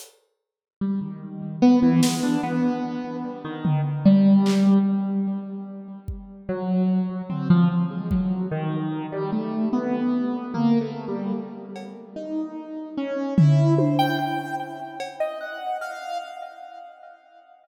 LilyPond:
<<
  \new Staff \with { instrumentName = "Acoustic Grand Piano" } { \time 5/4 \tempo 4 = 74 r4 g16 ees8. b16 e16 aes16 d'16 b4 g16 ees8 r16 | g4 r2 ges4 c'16 f16 r16 aes16 | ges8 ees8. g16 a8 b4 \tuplet 3/2 { bes8 a8 g8 } r4 | ees'4 des'8 e'8 c''16 g''16 g''8 r8. ees''16 ges''8 f''8 | }
  \new DrumStaff \with { instrumentName = "Drums" } \drummode { \time 5/4 hh4 r4 r8 sn8 r4 r8 tomfh8 | r8 hc8 r4 r8 bd8 r4 tomfh4 | bd4 r4 r4 tomfh4 r8 cb8 | r4 r8 tomfh8 tommh4 r8 cb8 r4 | }
>>